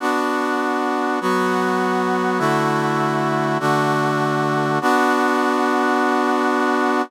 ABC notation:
X:1
M:4/4
L:1/8
Q:1/4=100
K:Bm
V:1 name="Brass Section"
[B,DF]4 [F,B,F]4 | [D,A,EF]4 [D,A,DF]4 | [B,DF]8 |]